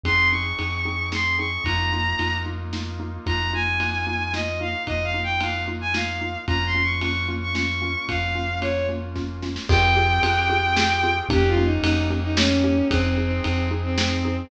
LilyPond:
<<
  \new Staff \with { instrumentName = "Violin" } { \time 3/4 \key f \minor \tempo 4 = 112 c'''8 des'''4. c'''8 des'''8 | bes''4. r4. | bes''8 aes''4. ees''8 f''8 | \tuplet 3/2 { ees''8 f''8 g''8 } f''8 r16 aes''16 f''4 |
\tuplet 3/2 { bes''8 c'''8 des'''8 } des'''8 r16 des'''16 des'''4 | f''4 des''8 r4. | g''2. | \tuplet 3/2 { g'8 f'8 ees'8 } ees'8 r16 ees'16 des'4 |
\tuplet 3/2 { c'8 c'8 c'8 } c'8 r16 c'16 c'4 | }
  \new Staff \with { instrumentName = "Xylophone" } { \time 3/4 \key f \minor <c' ees' aes'>8 <c' ees' aes'>8 <c' ees' aes'>8 <c' ees' aes'>8 <c' ees' aes'>8 <c' ees' aes'>8 | <bes ees' f'>8 <bes ees' f'>8 <bes ees' f'>8 <bes ees' f'>8 <bes ees' f'>8 <bes ees' f'>8 | <bes ees' f'>8 <bes ees' f'>8 <bes ees' f'>8 <bes ees' f'>8 <bes ees' f'>8 <bes ees' f'>8 | <bes ees' f'>8 <bes ees' f'>8 <bes ees' f'>8 <bes ees' f'>8 <bes ees' f'>8 <bes ees' f'>8 |
<bes des' f'>8 <bes des' f'>8 <bes des' f'>8 <bes des' f'>8 <bes des' f'>8 <bes des' f'>8 | <bes des' f'>8 <bes des' f'>8 <bes des' f'>8 <bes des' f'>8 <bes des' f'>8 <bes des' f'>8 | <c' f' g' aes'>8 <c' f' g' aes'>8 <c' f' g' aes'>8 <c' f' g' aes'>8 <c' f' g' aes'>8 <c' f' g' aes'>8 | <bes des' ees' g'>8 <bes des' ees' g'>8 <bes des' ees' g'>8 <bes des' ees' g'>8 <bes des' ees' g'>8 <bes des' ees' g'>8 |
<c' ees' aes'>8 <c' ees' aes'>8 <c' ees' aes'>8 <c' ees' aes'>8 <c' ees' aes'>8 <c' ees' aes'>8 | }
  \new Staff \with { instrumentName = "Synth Bass 2" } { \clef bass \time 3/4 \key f \minor f,4 f,2 | f,4 f,2 | f,2. | f,2. |
f,2. | f,2. | f,4 f,2 | f,4 f,2 |
f,4 f,2 | }
  \new Staff \with { instrumentName = "Brass Section" } { \time 3/4 \key f \minor <c' ees' aes'>2. | <bes ees' f'>2. | <bes ees' f'>2.~ | <bes ees' f'>2. |
<bes des' f'>2.~ | <bes des' f'>2. | <c' f' g' aes'>2. | <bes des' ees' g'>2. |
<c' ees' aes'>2. | }
  \new DrumStaff \with { instrumentName = "Drums" } \drummode { \time 3/4 <bd cymr>4 cymr4 sn4 | <bd cymr>4 cymr4 sn4 | <bd cymr>4 cymr4 sn4 | <bd cymr>4 cymr4 sn4 |
<bd cymr>4 cymr4 sn4 | <bd cymr>4 cymr4 <bd sn>8 sn16 sn16 | <cymc bd>4 cymr4 sn4 | <bd cymr>4 cymr4 sn4 |
<bd cymr>4 cymr4 sn4 | }
>>